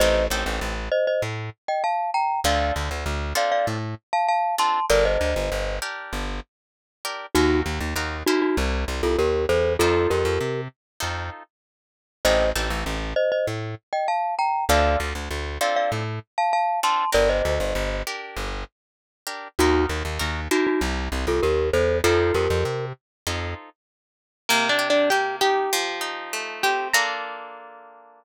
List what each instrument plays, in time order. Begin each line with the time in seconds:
0.00 electric bass (finger) A1, acoustic guitar (steel) C4 D#4 G4 A4, glockenspiel C5 D#5
0.30 electric bass (finger) A1, acoustic guitar (steel) C4 D#4 G4 A4
0.46 electric bass (finger) A1
0.61 electric bass (finger) A1
0.92 glockenspiel C5 D#5
1.07 glockenspiel C5 D#5
1.22 electric bass (finger) A2
1.68 glockenspiel D#5 G5
1.84 glockenspiel F5 A5
2.14 glockenspiel G5 A#5
2.44 electric bass (finger) D2, acoustic guitar (steel) C4 D4 F4 A4, glockenspiel D5 F5
2.76 electric bass (finger) D2
2.91 electric bass (finger) D2
3.06 electric bass (finger) D2
3.35 acoustic guitar (steel) C4 D4 F4 A4, glockenspiel D5 F5
3.52 glockenspiel D5 F5
3.67 electric bass (finger) A2
4.13 glockenspiel F5 A5
4.28 glockenspiel F5 A5
4.58 acoustic guitar (steel) C4 D4 F4 A4, glockenspiel A5 C6
4.90 electric bass (finger) G1, acoustic guitar (steel) D4 G4 A#4, glockenspiel A#4 D5
5.05 glockenspiel C5 D#5
5.21 electric bass (finger) D2
5.36 electric bass (finger) G1
5.52 electric bass (finger) G1
5.82 acoustic guitar (steel) D4 G4 A#4
6.13 electric bass (finger) G1
7.05 acoustic guitar (steel) D4 G4 A#4
7.35 electric bass (finger) D#2, glockenspiel D#4 F#4, acoustic guitar (steel) D#4 F#4 A#4
7.66 electric bass (finger) D#2
7.80 electric bass (finger) D#2
7.96 electric bass (finger) D#2, acoustic guitar (steel) D#4 F#4 A#4
8.26 glockenspiel D#4 F#4, acoustic guitar (steel) E4 G4 A#4 C5
8.42 glockenspiel D#4 F#4
8.57 electric bass (finger) C2
8.88 electric bass (finger) C2
9.03 electric bass (finger) C2, glockenspiel F4 A4
9.18 electric bass (finger) D#2, glockenspiel G4 A#4
9.49 electric bass (finger) E2, glockenspiel A4 C5
9.79 electric bass (finger) F2, acoustic guitar (steel) D#4 F4 A4 C5, glockenspiel F4 A4
10.10 electric bass (finger) F2, glockenspiel G4 A#4
10.25 electric bass (finger) F2
10.41 electric bass (finger) C3
11.00 electric bass (finger) F2, acoustic guitar (steel) D#4 F4 A4 C5
12.25 electric bass (finger) A1, acoustic guitar (steel) C4 D#4 G4 A4, glockenspiel C5 D#5
12.55 electric bass (finger) A1, acoustic guitar (steel) C4 D#4 G4 A4
12.70 electric bass (finger) A1
12.86 electric bass (finger) A1
13.16 glockenspiel C5 D#5
13.32 glockenspiel C5 D#5
13.47 electric bass (finger) A2
13.93 glockenspiel D#5 G5
14.08 glockenspiel F5 A5
14.39 glockenspiel G5 A#5
14.69 electric bass (finger) D2, acoustic guitar (steel) C4 D4 F4 A4, glockenspiel D5 F5
15.00 electric bass (finger) D2
15.15 electric bass (finger) D2
15.31 electric bass (finger) D2
15.61 acoustic guitar (steel) C4 D4 F4 A4, glockenspiel D5 F5
15.76 glockenspiel D5 F5
15.92 electric bass (finger) A2
16.38 glockenspiel F5 A5
16.53 glockenspiel F5 A5
16.83 acoustic guitar (steel) C4 D4 F4 A4, glockenspiel A5 C6
17.13 electric bass (finger) G1, acoustic guitar (steel) D4 G4 A#4, glockenspiel A#4 D5
17.29 glockenspiel C5 D#5
17.45 electric bass (finger) D2
17.60 electric bass (finger) G1
17.75 electric bass (finger) G1
18.07 acoustic guitar (steel) D4 G4 A#4
18.36 electric bass (finger) G1
19.27 acoustic guitar (steel) D4 G4 A#4
19.59 electric bass (finger) D#2, glockenspiel D#4 F#4, acoustic guitar (steel) D#4 F#4 A#4
19.89 electric bass (finger) D#2
20.05 electric bass (finger) D#2
20.19 electric bass (finger) D#2, acoustic guitar (steel) D#4 F#4 A#4
20.51 glockenspiel D#4 F#4, acoustic guitar (steel) E4 G4 A#4 C5
20.67 glockenspiel D#4 F#4
20.81 electric bass (finger) C2
21.12 electric bass (finger) C2
21.27 electric bass (finger) C2, glockenspiel F4 A4
21.43 electric bass (finger) D#2, glockenspiel G4 A#4
21.73 electric bass (finger) E2, glockenspiel A4 C5
22.04 electric bass (finger) F2, acoustic guitar (steel) D#4 F4 A4 C5, glockenspiel F4 A4
22.34 electric bass (finger) F2, glockenspiel G4 A#4
22.50 electric bass (finger) F2
22.65 electric bass (finger) C3
23.27 electric bass (finger) F2, acoustic guitar (steel) D#4 F4 A4 C5
24.49 acoustic guitar (steel) C3 A#3 A#4
24.69 acoustic guitar (steel) D4 D5
24.79 acoustic guitar (steel) G4
24.90 acoustic guitar (steel) D4 D5
25.10 acoustic guitar (steel) A#3 G4 G5
25.41 acoustic guitar (steel) D#4 G4 G5
25.73 acoustic guitar (steel) F3
26.01 acoustic guitar (steel) D#4
26.33 acoustic guitar (steel) A3
26.63 acoustic guitar (steel) C4 G4 G5
26.93 acoustic guitar (steel) A#3 D4 F4 A4 A#5